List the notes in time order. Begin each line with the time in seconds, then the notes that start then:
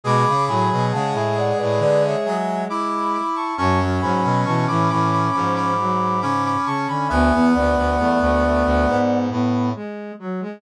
0.03 B2 G#3 G#4 B5 D6
0.28 C#3
0.47 A2 F#3 G#5 B5
0.72 B2
0.91 C#3 G#3 F#5 A5
1.13 A2 E5 G#5
1.37 D5 F#5
1.58 A2 B4 D5
1.79 D3 B4 D5
2.04 C#5 E5
2.25 F#3 E5 G#5
2.69 E4 B5 D6
3.14 B5 D6
3.36 A5 C#6
3.58 F#2 F#3 C#4 A5 C#6
3.79 F#3
4.01 G#2 F#3 G#5 B5
4.24 B2
4.45 B2 E3 A5 C#6
4.67 A2 E3 B5 D6
4.89 A2 E3 B5 D6
5.12 B5 D6
5.32 G#2 F3 B5 D6
5.55 B5 D6
5.78 F#3
6.21 C#3 C#4 B5 D6
6.45 B5 D6
6.66 C#3 A5 C#6
6.88 D3 G#5 B5
7.08 D2 B3 E5 G#5
7.32 E2 B3
7.54 D2 B3 D5 F#5
7.76 D2
7.98 E2 A3
8.21 D2 A3
8.43 A3
8.65 D2
8.87 G#2 B3
9.30 A2 B3
9.75 G#3
10.19 F#3
10.41 G#3